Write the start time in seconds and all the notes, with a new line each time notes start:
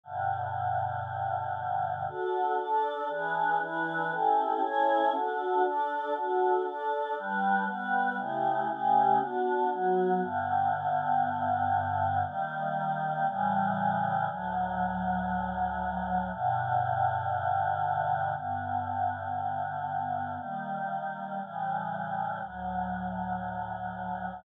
0.03 G2 B2 D3
2.08 D4 F#4 A4
2.58 D4 A4 D5
3.08 E3 D4 G#4 B4
3.60 E3 D4 E4 B4
4.10 C#4 E4 G4 A4
4.61 C#4 E4 A4 C#5
5.13 D4 F#4 A4
5.63 D4 A4 D5
6.14 D4 F#4 A4
6.65 D4 A4 D5
7.15 G3 D4 B4
7.66 G3 B3 B4
8.17 C#3 A3 E4 G4
8.68 C#3 A3 C#4 G4
9.19 B3 D4 F#4
9.70 F#3 B3 F#4
10.20 G2 D3 B3
12.24 D#3 G3 A#3
13.26 A2 C#3 E3 G3
14.27 D2 A2 F#3
16.31 G2 B2 D3
18.35 G2 D3 B3
20.37 D#3 G3 A#3
21.40 A2 C#3 E3 G3
22.41 D2 A2 F#3